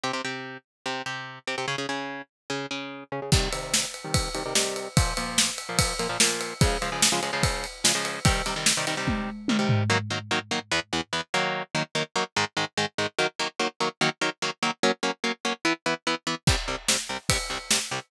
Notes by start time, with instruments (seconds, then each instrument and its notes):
0.04 overdriven guitar C3 C4 G4
0.13 overdriven guitar C3 C4 G4
0.25 overdriven guitar C3 C4 G4
0.86 overdriven guitar C3 C4 G4
1.06 overdriven guitar C3 C4 G4
1.47 overdriven guitar C3 C4 G4
1.58 overdriven guitar C3 C4 G4
1.68 overdriven guitar C#3 C#4 G#4
1.78 overdriven guitar C#3 C#4 G#4
1.89 overdriven guitar C#3 C#4 G#4
2.50 overdriven guitar C#3 C#4 G#4
2.71 overdriven guitar C#3 C#4 G#4
3.12 overdriven guitar C#3 C#4 G#4
3.22 overdriven guitar C#3 C#4 G#4
3.32 overdriven guitar C3 D#3 G3, kick, crash
3.53 overdriven guitar C3 D#3 G3, ride
3.74 snare
3.94 ride
4.04 overdriven guitar C3 D#3 G3
4.14 kick, ride
4.35 overdriven guitar C3 D#3 G3, ride
4.46 overdriven guitar C3 D#3 G3
4.55 overdriven guitar C3 D#3 G3, snare
4.76 ride
4.97 overdriven guitar A#2 F3 A#3, kick, ride
5.17 overdriven guitar A#2 F3 A#3, ride
5.38 snare
5.58 ride
5.69 overdriven guitar A#2 F3 A#3
5.79 kick, ride
5.99 overdriven guitar A#2 F3 A#3, ride
6.09 overdriven guitar A#2 F3 A#3
6.20 overdriven guitar A#2 F3 A#3, snare
6.41 ride
6.61 overdriven guitar C#3 F3 G#3, kick, ride
6.82 overdriven guitar C#3 F3 G#3, ride
6.92 overdriven guitar C#3 F3 G#3
7.02 snare
7.12 overdriven guitar C#3 F3 G#3
7.23 overdriven guitar C#3 F3 G#3, ride
7.33 overdriven guitar C#3 F3 G#3
7.43 kick, ride
7.64 ride
7.84 overdriven guitar C#3 F3 G#3, snare
7.95 overdriven guitar C#3 F3 G#3
8.05 ride
8.25 overdriven guitar C3 D#3 G3, kick, ride
8.46 overdriven guitar C3 D#3 G3, ride
8.56 overdriven guitar C3 D#3 G3
8.66 snare
8.77 overdriven guitar C3 D#3 G3
8.87 overdriven guitar C3 D#3 G3, ride
8.97 overdriven guitar C3 D#3 G3
9.07 kick, high tom
9.48 overdriven guitar C3 D#3 G3, high tom
9.59 overdriven guitar C3 D#3 G3
9.69 floor tom
9.90 overdriven guitar D#3 F#3 A#3
10.10 overdriven guitar D#3 F#3 A#3
10.31 overdriven guitar D#3 F#3 A#3
10.51 overdriven guitar D#3 F#3 A#3
10.71 overdriven guitar E2 E3 B3
10.93 overdriven guitar E2 E3 B3
11.13 overdriven guitar E2 E3 B3
11.34 overdriven guitar D#3 F#3 A#3
11.75 overdriven guitar D#3 F#3 A#3
11.95 overdriven guitar D#3 F#3 A#3
12.16 overdriven guitar D#3 F#3 A#3
12.36 overdriven guitar G#2 D#3 G#3
12.57 overdriven guitar G#2 D#3 G#3
12.77 overdriven guitar G#2 D#3 G#3
12.98 overdriven guitar G#2 D#3 G#3
13.19 overdriven guitar D#3 F#3 A#3
13.39 overdriven guitar D#3 F#3 A#3
13.60 overdriven guitar D#3 F#3 A#3
13.80 overdriven guitar D#3 F#3 A#3
14.01 overdriven guitar D#3 F#3 A#3
14.21 overdriven guitar D#3 F#3 A#3
14.42 overdriven guitar D#3 F#3 A#3
14.63 overdriven guitar D#3 F#3 A#3
14.83 overdriven guitar F#3 A#3 C#4
15.03 overdriven guitar F#3 A#3 C#4
15.24 overdriven guitar F#3 A#3 C#4
15.45 overdriven guitar F#3 A#3 C#4
15.65 overdriven guitar E3 B3 E4
15.86 overdriven guitar E3 B3 E4
16.07 overdriven guitar E3 B3 E4
16.27 overdriven guitar E3 B3 E4
16.47 overdriven guitar C2 C3 G3, kick, crash
16.68 overdriven guitar C2 C3 G3
16.88 overdriven guitar C2 C3 G3, snare
17.09 overdriven guitar C2 C3 G3
17.29 overdriven guitar C2 C3 G3, kick, ride
17.50 overdriven guitar C2 C3 G3
17.71 overdriven guitar C2 C3 G3, snare
17.91 overdriven guitar C2 C3 G3